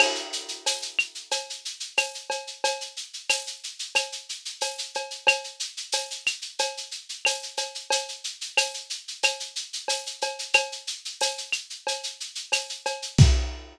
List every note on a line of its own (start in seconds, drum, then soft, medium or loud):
0.00 crash loud
0.00 cowbell loud
0.00 claves loud
0.15 shaker medium
0.33 shaker loud
0.48 shaker medium
0.66 tambourine medium
0.66 cowbell medium
0.66 shaker loud
0.82 shaker medium
0.99 claves loud
0.99 shaker medium
1.15 shaker medium
1.31 cowbell medium
1.31 shaker loud
1.50 shaker medium
1.65 shaker medium
1.80 shaker medium
1.97 tambourine medium
1.97 cowbell medium
1.97 claves loud
1.97 shaker loud
2.14 shaker medium
2.30 cowbell medium
2.30 shaker medium
2.47 shaker medium
2.64 cowbell loud
2.64 shaker loud
2.81 shaker medium
2.97 shaker medium
3.13 shaker medium
3.29 tambourine loud
3.29 cowbell medium
3.29 claves medium
3.29 shaker loud
3.47 shaker medium
3.63 shaker medium
3.79 shaker medium
3.95 cowbell medium
3.95 claves loud
3.95 shaker loud
4.12 shaker medium
4.29 shaker medium
4.45 shaker medium
4.61 tambourine medium
4.61 cowbell medium
4.61 shaker loud
4.78 shaker medium
4.94 cowbell medium
4.94 shaker medium
5.11 shaker medium
5.27 cowbell loud
5.27 claves loud
5.27 shaker loud
5.44 shaker medium
5.60 shaker medium
5.77 shaker medium
5.92 tambourine medium
5.92 cowbell medium
5.92 shaker loud
6.11 shaker medium
6.26 claves medium
6.26 shaker loud
6.42 shaker medium
6.59 cowbell loud
6.59 shaker loud
6.77 shaker medium
6.91 shaker medium
7.09 shaker medium
7.25 tambourine medium
7.25 cowbell medium
7.25 claves loud
7.25 shaker loud
7.43 shaker medium
7.57 cowbell medium
7.57 shaker loud
7.75 shaker medium
7.90 cowbell loud
7.90 shaker loud
8.09 shaker medium
8.24 shaker medium
8.41 shaker medium
8.57 tambourine medium
8.57 cowbell medium
8.57 claves loud
8.57 shaker loud
8.74 shaker medium
8.90 shaker medium
9.08 shaker medium
9.23 cowbell medium
9.23 claves loud
9.23 shaker loud
9.40 shaker medium
9.56 shaker medium
9.73 shaker medium
9.88 tambourine medium
9.88 cowbell medium
9.88 shaker loud
10.06 shaker medium
10.21 cowbell medium
10.21 shaker medium
10.39 shaker medium
10.54 cowbell loud
10.54 claves loud
10.54 shaker loud
10.72 shaker medium
10.87 shaker medium
11.05 shaker medium
11.21 tambourine medium
11.21 cowbell medium
11.21 shaker loud
11.38 shaker medium
11.52 claves medium
11.52 shaker medium
11.70 shaker medium
11.87 cowbell medium
11.87 shaker loud
12.03 shaker medium
12.20 shaker medium
12.35 shaker medium
12.52 tambourine medium
12.52 cowbell medium
12.52 claves medium
12.52 shaker loud
12.69 shaker medium
12.86 cowbell medium
12.86 shaker medium
13.02 shaker medium
13.18 kick loud
13.18 crash loud